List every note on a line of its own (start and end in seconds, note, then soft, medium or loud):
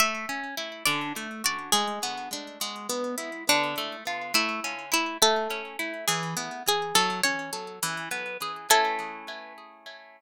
0.00 0.26 A3 loud
0.00 0.48 E5 medium
0.29 0.55 C#4 medium
0.57 0.83 E4 medium
0.86 1.13 D3 loud
0.86 1.41 D5 medium
1.16 1.42 A3 medium
1.44 1.70 F#4 medium
1.44 1.73 D5 medium
1.72 1.99 G#3 loud
1.72 2.70 G#4 medium
2.03 2.29 B3 medium
2.33 2.59 D4 medium
2.61 2.87 G#3 medium
2.89 3.15 B3 medium
3.18 3.44 E4 medium
3.49 3.75 D3 loud
3.49 3.96 D4 medium
3.78 4.04 A3 medium
4.07 4.33 F4 medium
4.34 4.60 A3 loud
4.34 4.86 E4 medium
4.64 4.90 C#4 medium
4.92 5.18 E4 medium
4.92 5.17 E4 medium
5.22 5.48 A3 loud
5.22 5.79 A4 medium
5.50 5.77 C#4 medium
5.79 6.05 E4 medium
6.08 6.34 E3 loud
6.08 6.61 G#4 medium
6.37 6.63 B3 medium
6.68 6.94 G#4 medium
6.68 6.96 G#4 medium
6.95 7.21 F#3 loud
6.95 7.21 A4 medium
7.23 7.50 C#4 medium
7.23 7.95 C#5 medium
7.53 7.79 A4 medium
7.83 8.09 E3 loud
8.11 8.37 B3 medium
8.42 8.68 G#4 medium
8.70 10.21 A3 loud
8.70 10.21 C#4 loud
8.70 10.21 E4 loud
8.70 10.21 A4 loud